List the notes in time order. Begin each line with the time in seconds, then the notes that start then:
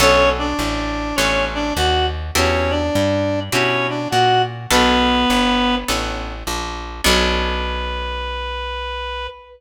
0.00 B1 B3 C#4 D4 A4 C#5
0.39 D4 D5
0.59 A1
1.16 A1 B3 C#4 D4 A4 C#5
1.54 D4 D5
1.76 D#2 F#4 F#5
2.35 E2 C#4 D4 E4 F#4 G4 C#5
2.70 D4 D5
2.95 G2
3.52 B2 C#4 D4 E4 F#4 G4 C#5
3.89 D4 D5
4.11 A#2 F#4 F#5
4.70 B1 B3 C#4 D4 A4 B4
5.30 G1
5.88 A1 B3 C#4 D4 A4
6.47 A#1
7.04 B1 B3 C#4 D4 A4 B4